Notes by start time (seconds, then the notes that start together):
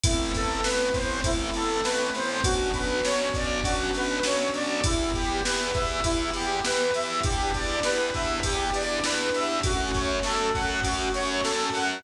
0.04 A1 A3 B3 C4 E4, kick, ride
0.34 A1 A4, kick, ride
0.63 A1 A3 B3 C4 E4 B4, snare
0.94 A1 C5, kick, ride
1.24 A1 A3 B3 C4 E4, kick, ride
1.54 A1 A4, ride
1.84 A1 A3 B3 C4 E4 B4, snare
2.14 A1 C5, ride
2.44 B1 B3 C#4 D4 F#4, kick, ride
2.74 B1 B4, kick, ride
3.03 B1 B3 C#4 D4 F#4 C#5, snare
3.34 B1 D5, kick, ride
3.64 B1 B3 C#4 D4 F#4, kick, ride
3.93 B1 B4, ride
4.23 B1 B3 C#4 D4 F#4 C#5, snare
4.54 B1 D5, ride
4.84 E2 B3 E4 G4, kick, ride
5.14 E2 G4, kick, ride
5.44 E2 B3 E4 G4 B4, snare
5.74 E2 E5, kick, ride
6.04 E2 B3 E4 G4, kick, ride
6.33 E2 G4, ride
6.64 E2 B3 E4 G4 B4, snare
6.94 E2 E5, ride
7.23 E2 B3 D4 E4 G4, kick, ride
7.54 E2 D5, kick, ride
7.83 E2 B3 D4 E4 G4 B4, snare
8.14 E2 E5, kick, ride
8.43 E2 B3 D4 E4 G4, kick, ride
8.73 E2 D5, ride
9.04 E2 B3 D4 E4 G4 B4, snare
9.34 E2 E5, ride
9.63 F#2 A3 C#4 F#4, kick, ride
9.94 F#2 C#5, kick, ride
10.23 F#2 A3 C#4 F#4 A4, snare
10.54 F#2 F#5, kick, ride
10.83 F#2 A3 C#4 F#4, kick, ride
11.14 F#2 C#5, ride
11.44 F#2 A3 C#4 F#4 A4, snare
11.74 F#2 F#5, ride